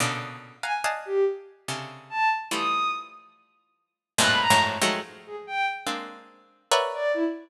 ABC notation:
X:1
M:6/4
L:1/16
Q:1/4=143
K:none
V:1 name="Harpsichord"
[_B,,=B,,_D,=D,]6 [f_g_a_b]2 [d_efga=a]8 [C,_D,=D,]8 | [E,F,G,A,]16 [F,,G,,_A,,=A,,_B,,]3 [F,,_G,,_A,,=A,,]3 [_E,F,_G,_A,=A,]2 | z8 [_A,_B,CD]8 [_B=B_d=de_g]6 z2 |]
V:2 name="Violin"
z6 _a z3 G2 z8 =a2 z2 | _e'4 z12 _g' b _b2 z4 | z2 _A z g2 z12 d2 E z3 |]